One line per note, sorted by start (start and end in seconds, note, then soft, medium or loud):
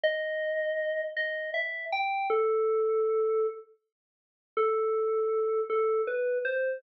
0.03 1.01 D#5 loud
1.17 1.50 D#5 loud
1.54 1.85 E5 medium
1.92 2.27 G5 loud
2.30 3.47 A4 loud
4.57 5.61 A4 loud
5.70 6.02 A4 loud
6.07 6.38 B4 loud
6.45 6.78 C5 loud